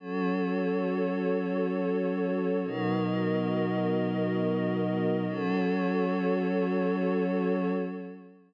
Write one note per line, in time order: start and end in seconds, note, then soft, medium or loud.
0.00 2.61 F#3 medium
0.00 2.61 C#4 medium
0.00 2.61 F#4 medium
0.00 2.61 A4 medium
0.00 2.61 C#5 medium
2.64 5.25 B2 medium
2.64 5.25 F#3 medium
2.64 5.25 B3 medium
2.64 5.25 D#4 medium
2.64 5.25 F#4 medium
2.64 5.25 A#4 medium
2.64 5.25 D#5 medium
5.27 7.71 F#3 loud
5.27 7.71 C#4 medium
5.27 7.71 F#4 loud
5.27 7.71 A4 loud
5.27 7.71 C#5 loud